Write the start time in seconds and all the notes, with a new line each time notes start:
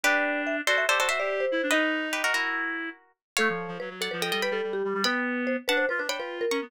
0.03 D4 G4 B4 D5
0.47 E5
0.67 F#4 A4 C5 D5
0.78 E5
0.89 G4 A4 C5 D5
0.99 F#4 A4 C5 D5
1.08 F#4 C5 E5
1.19 G4 D5
1.40 C5
1.52 E4
1.63 D4
1.71 D#4 B4 D#5
2.13 G4 B4
2.24 F#4 A#4
2.33 E4 F#4 A#4
3.37 A3 A4 C#5 F5
3.49 F3
3.68 F3
3.80 F#3 B4
3.90 F#3
4.01 A4 D5 F#5
4.11 F3 B4
4.22 A4 D#5 G5
4.32 G3 A4 D#5 G5
4.42 B4 G5 B5
4.51 G3 A4
4.63 G3
4.73 G4
4.84 G3
4.94 G3
5.04 B3 B4 G5 B5
5.47 C5
5.68 D4 B4 F#5 A5
5.77 C5
5.89 F4 B4
5.98 D4 B4
6.08 D4 C#5 G5 B5
6.18 F4 B4
6.41 A#4
6.51 C#4 A#5 C#6
6.62 B3